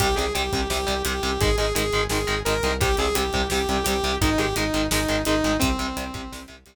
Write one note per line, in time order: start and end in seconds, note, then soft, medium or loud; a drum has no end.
0.00 0.15 C2 medium
0.00 0.06 C3 loud
0.00 0.06 G3 loud
0.00 0.15 G4 loud
0.00 kick loud
0.00 closed hi-hat loud
0.16 0.32 C2 medium
0.16 0.24 C3 medium
0.16 0.24 G3 medium
0.16 0.33 G#4 medium
0.16 closed hi-hat medium
0.35 0.50 C2 medium
0.35 0.42 C3 medium
0.35 0.42 G3 medium
0.35 0.68 G4 medium
0.35 closed hi-hat loud
0.52 0.68 C2 medium
0.52 0.60 C3 medium
0.52 0.60 G3 medium
0.52 kick medium
0.52 closed hi-hat medium
0.70 0.85 C2 medium
0.70 0.77 C3 medium
0.70 0.77 G3 medium
0.70 1.02 G4 loud
0.70 snare loud
0.87 1.03 C2 medium
0.87 0.94 C3 medium
0.87 0.94 G3 medium
0.87 closed hi-hat medium
1.05 1.20 C2 medium
1.05 1.12 C3 medium
1.05 1.12 G3 medium
1.05 1.40 G4 medium
1.05 closed hi-hat loud
1.23 1.38 C2 medium
1.23 1.30 C3 medium
1.23 1.30 G3 medium
1.23 closed hi-hat medium
1.40 1.55 G#1 medium
1.40 1.48 D#3 medium
1.40 1.48 G#3 medium
1.40 1.56 G#4 loud
1.40 kick loud
1.40 closed hi-hat loud
1.58 1.73 G#1 medium
1.58 1.65 D#3 medium
1.58 1.65 G#3 medium
1.58 1.73 G#4 loud
1.58 closed hi-hat medium
1.75 1.90 G#1 medium
1.75 1.82 D#3 medium
1.75 1.82 G#3 medium
1.75 2.04 G#4 loud
1.75 closed hi-hat loud
1.93 2.08 G#1 medium
1.93 2.00 D#3 medium
1.93 2.00 G#3 medium
1.93 closed hi-hat medium
2.10 2.26 G#1 medium
2.10 2.18 D#3 medium
2.10 2.18 G#3 medium
2.10 2.40 G#4 medium
2.10 snare loud
2.27 2.43 G#1 medium
2.27 2.34 D#3 medium
2.27 2.34 G#3 medium
2.27 closed hi-hat medium
2.45 2.61 G#1 medium
2.45 2.53 D#3 medium
2.45 2.53 G#3 medium
2.45 2.74 A#4 loud
2.45 closed hi-hat loud
2.63 2.96 C2 medium
2.63 2.71 D#3 medium
2.63 2.71 G#3 medium
2.63 closed hi-hat medium
2.81 2.88 C3 medium
2.81 2.88 G3 medium
2.81 2.96 G4 loud
2.81 kick loud
2.81 closed hi-hat loud
2.97 3.13 C2 medium
2.97 3.06 C3 medium
2.97 3.06 G3 medium
2.97 3.15 G#4 loud
2.97 closed hi-hat medium
3.15 3.31 C2 medium
3.15 3.22 C3 medium
3.15 3.22 G3 medium
3.15 3.48 G4 medium
3.15 closed hi-hat loud
3.33 3.48 C2 medium
3.33 3.41 C3 medium
3.33 3.41 G3 medium
3.33 kick medium
3.33 closed hi-hat medium
3.50 3.66 C2 medium
3.50 3.58 C3 medium
3.50 3.58 G3 medium
3.50 3.84 G4 loud
3.50 snare loud
3.68 3.83 C2 medium
3.68 3.76 C3 medium
3.68 3.76 G3 medium
3.68 closed hi-hat medium
3.84 4.01 C2 medium
3.84 3.93 C3 medium
3.84 3.93 G3 medium
3.84 4.16 G4 loud
3.84 closed hi-hat loud
4.04 4.18 C2 medium
4.04 4.11 C3 medium
4.04 4.11 G3 medium
4.04 closed hi-hat medium
4.21 4.36 G#1 medium
4.21 4.29 D#3 medium
4.21 4.29 G#3 medium
4.21 4.38 D#4 loud
4.21 kick loud
4.21 closed hi-hat loud
4.38 4.54 G#1 medium
4.38 4.45 D#3 medium
4.38 4.45 G#3 medium
4.38 4.55 G4 loud
4.38 closed hi-hat medium
4.56 4.71 G#1 medium
4.56 4.63 D#3 medium
4.56 4.63 G#3 medium
4.56 4.87 D#4 medium
4.56 closed hi-hat loud
4.74 4.89 G#1 medium
4.74 4.81 D#3 medium
4.74 4.81 G#3 medium
4.74 closed hi-hat medium
4.91 5.06 G#1 medium
4.91 4.99 D#3 medium
4.91 4.99 G#3 medium
4.91 5.22 D#4 medium
4.91 snare loud
5.08 5.24 G#1 medium
5.08 5.16 D#3 medium
5.08 5.16 G#3 medium
5.08 closed hi-hat medium
5.25 5.41 G#1 medium
5.25 5.34 D#3 medium
5.25 5.34 G#3 medium
5.25 5.57 D#4 loud
5.25 closed hi-hat loud
5.44 5.59 G#1 medium
5.44 5.51 D#3 medium
5.44 5.51 G#3 medium
5.44 closed hi-hat medium
5.59 5.76 C2 medium
5.59 5.67 C3 loud
5.59 5.67 G3 medium
5.59 6.43 C4 loud
5.59 kick loud
5.59 closed hi-hat loud
5.79 5.94 C2 medium
5.79 5.86 C3 medium
5.79 5.86 G3 medium
5.79 closed hi-hat medium
5.97 6.11 C2 medium
5.97 6.04 C3 medium
5.97 6.04 G3 medium
5.97 closed hi-hat loud
6.14 6.29 C2 medium
6.14 6.21 C3 medium
6.14 6.21 G3 medium
6.14 kick loud
6.14 closed hi-hat medium
6.32 6.47 C2 medium
6.32 6.39 C3 medium
6.32 6.39 G3 medium
6.32 snare loud
6.48 6.64 C2 medium
6.48 6.55 C3 medium
6.48 6.55 G3 medium
6.48 closed hi-hat medium
6.66 6.75 C2 medium
6.66 6.73 C3 medium
6.66 6.73 G3 medium
6.66 closed hi-hat loud